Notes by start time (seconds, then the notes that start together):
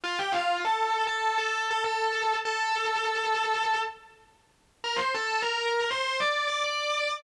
0.04 F4 F5
0.19 G4 G5
0.32 F4 F5
0.65 A4 A5
1.07 A4 A5
1.38 A4 A5
1.71 A4 A5
1.84 A4 A5
2.45 A4 A5
4.84 A#4 A#5
4.96 C5 C6
5.14 A4 A5
5.42 A#4 A#5
5.91 C5 C6
6.20 D5 D6
6.48 D5 D6
6.64 D5 D6